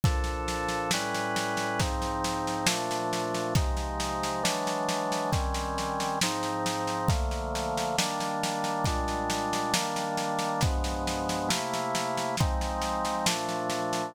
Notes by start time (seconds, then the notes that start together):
0.04 A#2 F3 D4 A4, kick, snare
0.24 snare
0.48 snare
0.69 snare
0.91 A2 G3 C#4 B4, snare
1.15 snare
1.36 snare
1.57 snare
1.79 G#2 F3 C4 D#4, kick, snare
2.02 snare
2.24 snare
2.47 snare
2.67 A#2 F3 A3 D4, snare
2.91 snare
3.13 snare
3.34 snare
3.55 C3 F3 G#3 D#4, kick, snare
3.77 snare
4.00 snare
4.23 snare
4.43 E3 F#3 G#3 D4, snare
4.67 snare
4.89 snare
5.12 snare
5.32 D#3 G3 C4 C#4, kick, snare
5.54 snare
5.78 snare
6.00 snare
6.21 G#2 F3 C4 D#4, snare
6.43 snare
6.66 snare
6.87 snare
7.08 D3 F3 A3 A#3, kick, snare
7.31 snare
7.55 snare
7.77 snare
7.98 D#3 G3 A#3 D4, snare
8.20 snare
8.43 snare
8.64 snare
8.84 A#2 G3 G#3 D4, kick, snare
9.08 snare
9.30 snare
9.53 snare
9.74 D#3 G3 A#3 D4, snare
9.96 snare
10.17 snare
10.39 snare
10.61 G2 F3 G#3 B3, kick, snare
10.84 snare
11.07 snare
11.29 snare
11.49 C3 A3 A#3 E4, snare
11.74 snare
11.95 snare
12.17 snare
12.37 F3 G#3 C4 D#4, kick, snare
12.61 snare
12.82 snare
13.05 snare
13.26 A#2 F3 A3 D4, snare
13.49 snare
13.70 snare
13.93 snare